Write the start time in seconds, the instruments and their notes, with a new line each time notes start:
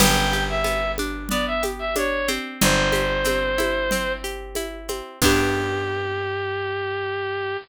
0.00 electric bass (finger) G1, acoustic guitar (steel) B3, clarinet G5, crash, low conga, shaker
0.33 acoustic guitar (steel) G4, shaker
0.49 clarinet E5
0.64 acoustic guitar (steel) B3, high conga, shaker
0.98 acoustic guitar (steel) D4, high conga, shaker
1.29 acoustic guitar (steel) B3, clarinet D5, low conga, shaker
1.47 clarinet E5
1.63 acoustic guitar (steel) G4, high conga, shaker
1.79 clarinet E5
1.96 acoustic guitar (steel) D4, clarinet C#5, high conga, shaker
2.28 acoustic guitar (steel) C4, high conga, shaker
2.61 electric bass (finger) G1, clarinet C5, low conga, shaker
2.92 acoustic guitar (steel) G4, high conga, shaker
3.24 acoustic guitar (steel) C4, high conga, shaker
3.58 acoustic guitar (steel) E4, high conga, shaker
3.91 acoustic guitar (steel) C4, low conga, shaker
4.24 acoustic guitar (steel) G4, shaker
4.55 acoustic guitar (steel) E4, high conga, shaker
4.88 acoustic guitar (steel) C4, high conga, shaker
5.22 electric bass (finger) G2, acoustic guitar (steel) B3 D4 G4, clarinet G4, kick, crash